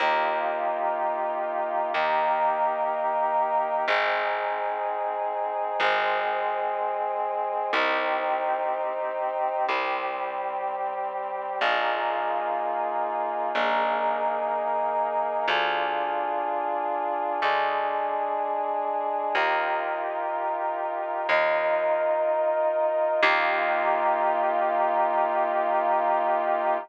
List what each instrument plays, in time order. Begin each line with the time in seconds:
0.00 electric bass (finger) D#2, brass section A#3 D#4 F4 G4
1.94 electric bass (finger) D#2, brass section A#3 D#4 G4 A#4
3.87 electric bass (finger) G#1, brass section C4 D#4 G#4
5.80 electric bass (finger) G#1, brass section G#3 C4 G#4
7.73 electric bass (finger) C2, brass section C4 D#4 G4
9.67 electric bass (finger) C2, brass section G3 C4 G4
11.61 electric bass (finger) A#1, brass section A#3 D#4 F4 G#4
13.55 electric bass (finger) A#1, brass section A#3 D#4 G#4 A#4
15.48 electric bass (finger) D2, brass section D4 F4 G#4
17.42 electric bass (finger) D2, brass section G#3 D4 G#4
19.35 electric bass (finger) D#2, brass section D#4 F4 G4 A#4
21.29 electric bass (finger) D#2, brass section D#4 F4 A#4 D#5
23.22 electric bass (finger) D#2, brass section A#3 D#4 F4 G4